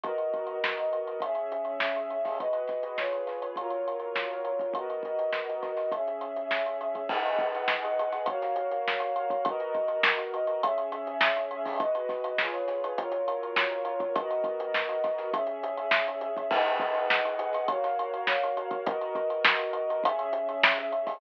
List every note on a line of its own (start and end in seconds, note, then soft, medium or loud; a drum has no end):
0.04 1.20 B3 medium
0.04 1.20 F#4 medium
0.04 1.20 A#4 medium
0.04 1.20 D#5 medium
0.04 kick medium
0.04 closed hi-hat medium
0.18 closed hi-hat medium
0.34 kick medium
0.34 closed hi-hat medium
0.47 closed hi-hat medium
0.64 snare loud
0.78 closed hi-hat medium
0.93 closed hi-hat medium
1.07 closed hi-hat medium
1.20 2.38 C#4 medium
1.20 2.38 G#4 medium
1.20 2.38 E5 medium
1.20 kick medium
1.20 closed hi-hat loud
1.35 closed hi-hat medium
1.52 closed hi-hat medium
1.65 closed hi-hat medium
1.80 snare loud
1.96 closed hi-hat medium
2.10 closed hi-hat medium
2.25 kick medium
2.25 snare soft
2.25 open hi-hat medium
2.39 2.97 G#3 medium
2.39 2.97 F#4 medium
2.39 2.97 B4 medium
2.39 2.97 D#5 medium
2.39 kick medium
2.39 closed hi-hat medium
2.53 closed hi-hat medium
2.68 kick medium
2.68 snare soft
2.68 closed hi-hat medium
2.83 closed hi-hat medium
2.98 3.56 F4 medium
2.98 3.56 G#4 medium
2.98 3.56 B4 medium
2.98 3.56 C#5 medium
2.98 snare medium
3.13 closed hi-hat medium
3.27 snare soft
3.27 closed hi-hat medium
3.42 closed hi-hat medium
3.56 4.74 F#3 medium
3.56 4.74 F4 medium
3.56 4.74 A#4 medium
3.56 4.74 C#5 medium
3.56 kick medium
3.56 closed hi-hat medium
3.70 closed hi-hat medium
3.88 closed hi-hat medium
4.00 closed hi-hat medium
4.16 snare medium
4.31 closed hi-hat soft
4.45 closed hi-hat medium
4.59 kick medium
4.59 closed hi-hat medium
4.74 5.91 B3 medium
4.74 5.91 F#4 medium
4.74 5.91 A#4 medium
4.74 5.91 D#5 medium
4.74 kick medium
4.74 closed hi-hat medium
4.90 closed hi-hat medium
5.03 kick medium
5.03 closed hi-hat medium
5.19 closed hi-hat medium
5.33 snare medium
5.49 closed hi-hat medium
5.63 kick medium
5.63 snare soft
5.63 closed hi-hat medium
5.77 snare soft
5.77 closed hi-hat medium
5.92 7.08 C#4 medium
5.92 7.08 G#4 medium
5.92 7.08 E5 medium
5.92 kick medium
5.92 closed hi-hat medium
6.07 closed hi-hat medium
6.21 closed hi-hat medium
6.36 closed hi-hat medium
6.51 snare medium
6.66 closed hi-hat medium
6.81 closed hi-hat medium
6.95 kick medium
6.95 closed hi-hat medium
7.09 8.26 G#4 loud
7.09 8.26 B4 medium
7.09 8.26 D#5 loud
7.09 8.26 F#5 medium
7.09 kick medium
7.09 crash loud
7.26 closed hi-hat medium
7.39 kick medium
7.39 closed hi-hat medium
7.55 closed hi-hat medium
7.68 snare loud
7.85 closed hi-hat medium
7.99 closed hi-hat medium
8.12 snare soft
8.12 closed hi-hat medium
8.26 9.44 F#4 medium
8.26 9.44 A#4 medium
8.26 9.44 C#5 medium
8.26 9.44 F5 medium
8.26 kick medium
8.26 closed hi-hat loud
8.42 snare soft
8.42 closed hi-hat medium
8.56 closed hi-hat medium
8.71 closed hi-hat medium
8.88 snare loud
9.00 closed hi-hat medium
9.16 closed hi-hat medium
9.30 kick medium
9.30 closed hi-hat medium
9.45 10.62 B3 medium
9.45 10.62 F#4 loud
9.45 10.62 A#4 loud
9.45 10.62 D#5 medium
9.45 kick loud
9.45 closed hi-hat loud
9.60 closed hi-hat medium
9.75 kick medium
9.75 closed hi-hat medium
9.88 closed hi-hat medium
10.03 snare loud
10.18 closed hi-hat medium
10.34 closed hi-hat medium
10.47 closed hi-hat medium
10.63 11.79 C#4 loud
10.63 11.79 G#4 medium
10.63 11.79 E5 loud
10.63 kick medium
10.63 closed hi-hat loud
10.78 closed hi-hat medium
10.92 closed hi-hat medium
11.07 closed hi-hat medium
11.21 snare loud
11.36 closed hi-hat medium
11.51 closed hi-hat medium
11.65 kick medium
11.65 snare soft
11.65 open hi-hat medium
11.80 12.39 G#3 medium
11.80 12.39 F#4 medium
11.80 12.39 B4 medium
11.80 12.39 D#5 medium
11.80 kick loud
11.80 closed hi-hat loud
11.95 closed hi-hat medium
12.09 kick medium
12.09 snare soft
12.09 closed hi-hat medium
12.24 closed hi-hat medium
12.38 12.97 F4 medium
12.38 12.97 G#4 medium
12.38 12.97 B4 medium
12.38 12.97 C#5 medium
12.38 snare loud
12.54 closed hi-hat medium
12.68 snare soft
12.68 closed hi-hat medium
12.84 closed hi-hat medium
12.98 14.15 F#3 loud
12.98 14.15 F4 loud
12.98 14.15 A#4 medium
12.98 14.15 C#5 medium
12.98 kick medium
12.98 closed hi-hat loud
13.12 closed hi-hat medium
13.28 closed hi-hat medium
13.43 closed hi-hat medium
13.56 snare loud
13.71 closed hi-hat medium
13.85 closed hi-hat medium
14.00 kick medium
14.00 closed hi-hat medium
14.16 15.32 B3 medium
14.16 15.32 F#4 medium
14.16 15.32 A#4 medium
14.16 15.32 D#5 medium
14.16 kick loud
14.16 closed hi-hat loud
14.31 closed hi-hat medium
14.44 kick medium
14.44 closed hi-hat medium
14.60 closed hi-hat medium
14.74 snare loud
14.89 closed hi-hat medium
15.04 kick medium
15.04 snare soft
15.04 closed hi-hat medium
15.18 snare soft
15.18 closed hi-hat medium
15.33 16.50 C#4 medium
15.33 16.50 G#4 medium
15.33 16.50 E5 medium
15.33 kick loud
15.33 closed hi-hat loud
15.47 closed hi-hat medium
15.63 closed hi-hat medium
15.77 closed hi-hat medium
15.91 snare loud
16.08 closed hi-hat medium
16.21 closed hi-hat medium
16.37 kick medium
16.37 closed hi-hat medium
16.51 17.67 G#4 loud
16.51 17.67 B4 medium
16.51 17.67 D#5 loud
16.51 17.67 F#5 loud
16.51 kick loud
16.51 crash loud
16.66 closed hi-hat medium
16.80 kick loud
16.80 closed hi-hat medium
16.95 closed hi-hat medium
17.10 snare loud
17.25 closed hi-hat medium
17.39 closed hi-hat medium
17.53 snare soft
17.53 closed hi-hat medium
17.68 18.85 F#4 loud
17.68 18.85 A#4 medium
17.68 18.85 C#5 loud
17.68 18.85 F5 medium
17.68 kick medium
17.68 closed hi-hat loud
17.84 snare soft
17.84 closed hi-hat medium
17.99 closed hi-hat medium
18.14 closed hi-hat medium
18.27 snare loud
18.43 closed hi-hat medium
18.57 closed hi-hat medium
18.71 kick medium
18.71 closed hi-hat medium
18.86 20.03 B3 medium
18.86 20.03 F#4 loud
18.86 20.03 A#4 loud
18.86 20.03 D#5 loud
18.86 kick loud
18.86 closed hi-hat loud
19.01 closed hi-hat medium
19.15 kick medium
19.15 closed hi-hat medium
19.30 closed hi-hat medium
19.45 snare loud
19.59 closed hi-hat medium
19.73 closed hi-hat medium
19.90 closed hi-hat medium
20.04 21.20 C#4 loud
20.04 21.20 G#4 loud
20.04 21.20 E5 loud
20.04 kick medium
20.04 closed hi-hat loud
20.19 closed hi-hat medium
20.33 closed hi-hat medium
20.49 closed hi-hat medium
20.63 snare loud
20.78 closed hi-hat medium
20.92 closed hi-hat medium
21.07 kick medium
21.07 snare soft
21.07 open hi-hat medium